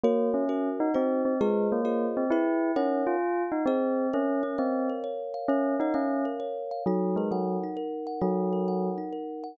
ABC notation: X:1
M:3/4
L:1/8
Q:"Swing" 1/4=132
K:Db
V:1 name="Tubular Bells"
B, D2 E C C | A, B,2 C _F2 | D F2 E C2 | [K:Bbm] D D C z3 |
D E D z3 | G, A, G, z3 | G,3 z3 |]
V:2 name="Kalimba"
[GBd]2 [GBd]2 [EGc]2 | [FAce]2 [FAce]2 [_FA_c]2 | [EBdg]4 [Ace]2 | [K:Bbm] B d f B d f |
B d f B d f | E B g E B g | E B g E B g |]